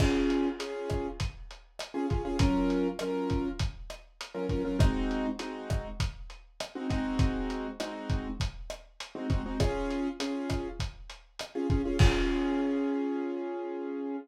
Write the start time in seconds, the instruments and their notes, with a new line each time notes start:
0.00 acoustic grand piano C#4 F4 G#4, kick, cross-stick, crash
0.30 closed hi-hat
0.59 acoustic grand piano C#4 F4 G#4, closed hi-hat
0.90 kick, cross-stick, closed hi-hat
1.20 kick, closed hi-hat
1.51 closed hi-hat
1.79 cross-stick, closed hi-hat
1.94 acoustic grand piano C#4 F4 G#4
2.10 acoustic grand piano C#4 F4 G#4, kick, closed hi-hat
2.25 acoustic grand piano C#4 F4 G#4
2.39 acoustic grand piano F#3 C#4 F4 A#4, kick, closed hi-hat
2.70 closed hi-hat
2.99 acoustic grand piano F#3 C#4 F4 A#4, cross-stick, closed hi-hat
3.30 kick, closed hi-hat
3.59 kick, closed hi-hat
3.90 cross-stick, closed hi-hat
4.21 closed hi-hat
4.34 acoustic grand piano F#3 C#4 F4 A#4
4.49 acoustic grand piano F#3 C#4 F4 A#4, kick, closed hi-hat
4.65 acoustic grand piano F#3 C#4 F4 A#4
4.79 acoustic grand piano G#3 C4 D#4 F#4, kick, cross-stick, closed hi-hat
5.11 closed hi-hat
5.39 acoustic grand piano G#3 C4 D#4 F#4, closed hi-hat
5.70 kick, cross-stick, closed hi-hat
6.00 kick, closed hi-hat
6.30 closed hi-hat
6.60 cross-stick, closed hi-hat
6.75 acoustic grand piano G#3 C4 D#4 F#4
6.90 acoustic grand piano G#3 C4 D#4 F#4, kick, closed hi-hat
7.19 kick, closed hi-hat
7.50 closed hi-hat
7.80 acoustic grand piano G#3 C4 D#4 F#4, cross-stick, closed hi-hat
8.10 kick, closed hi-hat
8.40 kick, closed hi-hat
8.70 cross-stick, closed hi-hat
9.00 closed hi-hat
9.15 acoustic grand piano G#3 C4 D#4 F#4
9.30 acoustic grand piano G#3 C4 D#4 F#4, kick, closed hi-hat
9.46 acoustic grand piano G#3 C4 D#4 F#4
9.60 acoustic grand piano C#4 F4 G#4, kick, cross-stick, closed hi-hat
9.90 closed hi-hat
10.20 acoustic grand piano C#4 F4 G#4, closed hi-hat
10.50 kick, cross-stick, closed hi-hat
10.80 kick, closed hi-hat
11.10 closed hi-hat
11.39 cross-stick, closed hi-hat
11.55 acoustic grand piano C#4 F4 G#4
11.70 acoustic grand piano C#4 F4 G#4, kick, closed hi-hat
11.85 acoustic grand piano C#4 F4 G#4
11.99 acoustic grand piano C#4 F4 G#4, kick, crash